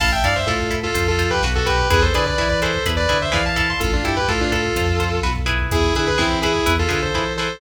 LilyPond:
<<
  \new Staff \with { instrumentName = "Distortion Guitar" } { \time 4/4 \key a \minor \tempo 4 = 126 <f'' a''>16 <e'' g''>16 <d'' f''>16 <c'' e''>16 <f' a'>8. <f' a'>8 <f' a'>8 <g' b'>16 r16 <fis' a'>16 <g' b'>8 | <gis' b'>16 <a' c''>16 <b' d''>16 <b' d''>8 <b' d''>16 <a' c''>8 r16 <b' d''>8 <c'' e''>16 <d'' f''>16 <f'' a''>16 <f'' a''>16 <a'' c'''>16 | <f' a'>16 <d' f'>16 <e' g'>16 <g' b'>16 <f' a'>16 <d' f'>16 <f' a'>4. r4 | <e' gis'>8 <e' gis'>16 <gis' b'>16 <c' e'>8 <e' gis'>8. <f' a'>16 <f' a'>16 <a' c''>8. <a' c''>8 | }
  \new Staff \with { instrumentName = "Overdriven Guitar" } { \time 4/4 \key a \minor <e' a'>8 <e' a'>8 <e' a'>8 <e' a'>8 <f' c''>8 <f' c''>8 <fis' b'>8 <fis' b'>8 | <e' gis' b'>8 <e' gis' b'>8 <e' gis' b'>8 <e' gis' b'>8 <e' gis' b'>8 <e' gis' b'>8 <e' gis' b'>8 <e' a'>8~ | <e' a'>8 <e' a'>8 <e' a'>8 <e' a'>8 <f' c''>8 <f' c''>8 <fis' b'>8 <e' gis' b'>8~ | <e' gis' b'>8 <e' gis' b'>8 <e' gis' b'>8 <e' gis' b'>8 <e' gis' b'>8 <e' gis' b'>8 <e' gis' b'>8 <e' gis' b'>8 | }
  \new Staff \with { instrumentName = "Synth Bass 1" } { \clef bass \time 4/4 \key a \minor a,,8 g,8 a,4 f,4 b,,4 | e,8 d8 e4 e,8 d8 e4 | a,,8 g,8 a,4 f,4 b,,4 | e,8 d8 e4 e,8 d8 e4 | }
  \new DrumStaff \with { instrumentName = "Drums" } \drummode { \time 4/4 <cymc bd>16 bd16 <hh bd>16 bd16 <bd sn>16 bd16 <hh bd>16 bd16 <hh bd>16 bd16 <hh bd>16 bd16 <bd sn>16 bd16 <hh bd>16 bd16 | <hh bd>16 bd16 <hh bd>16 bd16 <bd sn>16 bd16 <hh bd>16 bd16 <hh bd>16 bd16 <hh bd>16 bd16 <bd sn>16 bd16 <hh bd>16 bd16 | <hh bd>16 bd16 <hh bd>16 bd16 <bd sn>16 bd16 <hh bd>16 bd16 <hh bd>16 bd16 <hh bd>16 bd16 <bd sn>16 bd16 <hh bd>16 bd16 | <hh bd>16 bd16 <hh bd>16 bd16 <bd sn>16 bd16 <hh bd>16 bd16 <hh bd>16 bd16 <hh bd>16 bd16 <bd sn>8 sn8 | }
>>